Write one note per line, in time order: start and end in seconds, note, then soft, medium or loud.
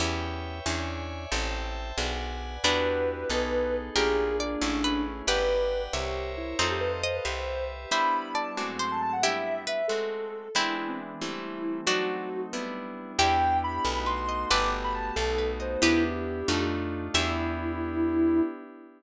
0.00 0.61 E2 loud
0.00 0.59 B3 loud
0.00 0.59 C#4 loud
0.00 0.59 E4 loud
0.00 0.59 G4 loud
0.00 0.65 B4 medium
0.00 0.65 C#5 medium
0.00 0.65 E5 medium
0.00 0.65 G5 medium
0.66 1.27 E2 loud
0.66 1.25 C#4 medium
0.66 1.25 D4 medium
0.66 1.25 E4 medium
0.66 1.25 G#4 medium
0.66 1.31 C#5 medium
0.66 1.31 D5 medium
0.66 1.31 E5 medium
0.66 1.31 G#5 medium
1.32 1.93 A1 loud
1.32 1.91 C4 loud
1.32 1.91 E4 loud
1.32 1.91 G4 medium
1.32 1.91 A4 loud
1.32 1.97 C5 medium
1.32 1.97 E5 medium
1.32 1.97 G5 medium
1.32 1.97 A5 medium
1.98 2.58 B1 medium
1.98 2.57 B3 medium
1.98 2.57 D4 loud
1.98 2.57 F#4 loud
1.98 2.57 G#4 medium
1.98 2.63 B4 medium
1.98 2.63 D5 medium
1.98 2.63 F#5 medium
1.98 2.63 G#5 medium
2.64 3.24 E2 medium
2.64 3.62 B3 medium
2.64 3.29 D4 medium
2.64 3.23 D4 medium
2.64 3.62 D4 medium
2.64 3.29 E4 medium
2.64 3.23 E4 medium
2.64 3.29 F#4 medium
2.64 3.23 F#4 loud
2.64 3.29 G4 medium
2.64 3.23 G4 medium
2.64 3.76 B4 medium
3.29 3.90 B1 medium
3.29 3.95 B3 medium
3.29 3.90 B3 loud
3.29 3.95 D#4 medium
3.29 3.90 D#4 loud
3.29 3.95 G#4 medium
3.29 3.90 G#4 medium
3.29 3.95 A4 medium
3.29 3.90 A4 loud
3.96 4.56 A#1 medium
3.96 4.61 A#3 medium
3.96 4.55 A#3 medium
3.96 4.61 D4 medium
3.96 4.55 D4 loud
3.96 4.61 F4 medium
3.96 4.55 F4 medium
3.96 4.33 G4 medium
3.96 4.36 G#4 medium
3.96 4.61 G#4 medium
3.96 4.55 G#4 medium
3.96 4.33 A#4 medium
4.39 5.02 D4 medium
4.39 4.79 D5 medium
4.61 5.22 A1 medium
4.61 5.21 A3 loud
4.61 5.27 A3 medium
4.61 5.21 C#4 medium
4.61 5.27 C#4 medium
4.61 5.21 E4 loud
4.61 5.27 E4 medium
4.61 5.21 G#4 medium
4.61 5.27 G#4 medium
4.84 5.26 B4 medium
5.27 5.88 G1 medium
5.27 6.54 G4 medium
5.27 5.93 B4 medium
5.27 6.54 B4 medium
5.27 5.82 B4 medium
5.27 5.87 B4 medium
5.27 5.93 D5 medium
5.27 5.87 D5 loud
5.27 5.93 F#5 medium
5.27 5.87 F#5 loud
5.27 5.93 G5 medium
5.27 5.87 G5 loud
5.93 6.54 C2 medium
5.93 6.31 G4 medium
5.93 6.53 A#4 medium
5.93 6.59 A#4 medium
5.93 6.53 C5 medium
5.93 6.59 C5 medium
5.93 6.53 C#5 loud
5.93 6.59 C#5 medium
5.93 6.53 E5 loud
5.93 6.59 E5 medium
6.37 6.55 E4 medium
6.59 7.20 F2 medium
6.59 7.02 C4 medium
6.59 7.02 D#4 medium
6.59 6.71 F4 medium
6.59 7.25 A4 medium
6.59 7.19 A4 medium
6.59 7.25 C5 medium
6.59 7.19 C5 loud
6.59 7.25 D#5 medium
6.59 7.19 D#5 medium
6.59 7.25 F5 medium
6.59 7.19 F5 medium
6.71 6.81 G4 medium
6.80 6.91 B4 medium
7.03 7.13 C5 medium
7.03 7.40 D#5 medium
7.15 7.26 B4 medium
7.25 7.86 C2 medium
7.25 7.84 G4 medium
7.25 7.91 G4 medium
7.25 7.84 B4 loud
7.25 7.91 B4 medium
7.25 7.84 C5 loud
7.25 7.91 C5 medium
7.25 7.63 C5 medium
7.25 7.84 E5 medium
7.25 7.91 E5 medium
7.91 8.56 G3 medium
7.91 8.51 G3 medium
7.91 8.56 B3 medium
7.91 8.51 B3 medium
7.91 8.56 D4 medium
7.91 8.51 D4 medium
7.91 8.56 E4 medium
7.91 8.51 E4 medium
7.91 8.28 C5 medium
7.91 8.28 E5 medium
7.91 8.30 B5 medium
8.34 8.72 D5 medium
8.34 8.53 A5 medium
8.57 9.22 G#2 medium
8.57 9.22 F#3 medium
8.57 9.17 G#3 medium
8.57 9.22 A3 medium
8.57 9.17 A3 medium
8.57 9.22 C4 medium
8.57 9.17 C4 medium
8.57 9.17 F#4 medium
8.57 8.67 D6 medium
8.79 9.21 C5 medium
8.79 8.90 C6 medium
8.91 9.01 A5 medium
9.02 9.12 A5 medium
9.13 9.23 F#5 medium
9.22 9.83 G3 medium
9.22 9.83 B3 medium
9.22 9.83 D4 medium
9.22 9.65 E4 medium
9.22 9.83 E4 medium
9.22 9.65 G4 medium
9.22 9.61 E5 medium
9.67 10.06 B4 medium
9.67 9.86 E5 medium
9.88 10.49 G#3 medium
9.88 10.49 A3 medium
9.88 10.49 C4 medium
9.88 10.49 F#4 medium
9.88 10.48 A4 medium
10.55 11.14 E3 medium
10.55 11.20 E3 medium
10.55 11.14 G#3 medium
10.55 11.20 G#3 medium
10.55 11.14 B3 medium
10.55 11.20 B3 medium
10.55 11.75 C4 medium
10.55 11.14 D4 medium
10.55 11.20 D4 medium
10.55 10.74 E4 medium
10.55 11.75 E4 medium
10.78 10.89 E4 medium
10.88 10.99 C4 medium
11.21 11.86 E3 medium
11.21 11.81 E3 medium
11.21 11.86 G3 medium
11.21 11.81 G3 medium
11.21 11.86 A3 medium
11.21 11.81 A3 medium
11.21 11.86 C4 medium
11.21 11.81 C4 medium
11.21 11.77 E4 medium
11.86 12.46 F#3 medium
11.86 12.52 F#3 medium
11.86 12.46 A3 medium
11.86 12.52 A3 medium
11.86 12.46 C4 medium
11.86 12.52 C4 medium
11.86 12.29 D4 medium
11.86 12.46 D#4 medium
11.86 12.52 D#4 medium
11.86 12.41 F#4 medium
11.86 12.29 F#4 medium
12.53 13.18 G3 medium
12.53 13.12 G3 medium
12.53 13.18 B3 medium
12.53 13.12 B3 medium
12.53 13.18 D4 medium
12.53 13.12 D4 medium
12.53 13.18 E4 medium
12.53 13.12 E4 medium
13.19 13.79 E2 medium
13.19 13.84 B3 medium
13.19 13.84 D4 medium
13.19 13.84 E4 medium
13.19 14.15 E4 medium
13.19 13.84 G4 medium
13.19 14.15 G4 loud
13.19 13.78 B4 loud
13.19 13.78 D5 loud
13.19 13.78 E5 loud
13.19 13.78 G5 loud
13.19 13.57 G5 medium
13.64 14.04 B5 medium
13.85 14.45 B1 medium
13.85 14.50 A3 medium
13.85 14.50 B3 medium
13.85 14.50 D#4 medium
13.85 14.50 F#4 medium
13.85 14.04 A4 loud
14.06 14.26 B4 medium
14.06 14.45 C6 medium
14.29 14.48 D#5 medium
14.50 15.11 G1 medium
14.50 15.16 A3 medium
14.50 15.16 B3 medium
14.50 15.16 F#4 medium
14.50 15.16 G4 medium
14.50 15.10 A4 loud
14.50 15.10 B4 loud
14.50 15.77 B4 medium
14.50 15.77 D5 loud
14.50 15.10 F#5 loud
14.50 15.10 G5 loud
14.50 14.70 D6 medium
14.84 14.94 B5 medium
14.95 15.15 A5 medium
15.15 15.77 B1 medium
15.15 15.82 A3 medium
15.15 15.82 B3 medium
15.15 15.82 D#4 medium
15.15 15.82 F#4 medium
15.15 15.51 A4 medium
15.15 15.37 A4 loud
15.38 15.58 B4 medium
15.60 15.81 C5 medium
15.60 15.80 D#5 medium
15.82 16.43 E2 medium
15.82 16.41 B3 loud
15.82 16.48 B3 medium
15.82 16.41 D4 loud
15.82 16.48 D4 medium
15.82 16.41 E4 loud
15.82 16.03 E4 medium
15.82 16.48 E4 medium
15.82 16.41 G4 loud
15.82 16.48 G4 medium
15.82 16.59 G4 medium
15.82 16.59 B4 medium
16.04 16.64 G4 medium
16.48 17.09 F2 medium
16.48 17.08 A3 loud
16.48 17.14 A3 medium
16.48 17.08 D4 loud
16.48 17.14 D4 medium
16.48 17.08 D#4 loud
16.48 17.14 D#4 medium
16.48 17.08 F4 loud
16.48 17.14 F4 medium
17.14 18.41 E2 loud
17.14 18.41 B3 loud
17.14 18.41 D4 loud
17.14 18.41 E4 loud
17.14 18.41 E4 medium
17.14 18.41 E4 loud
17.14 18.41 G4 medium
17.14 18.41 G4 loud
17.14 18.42 E5 loud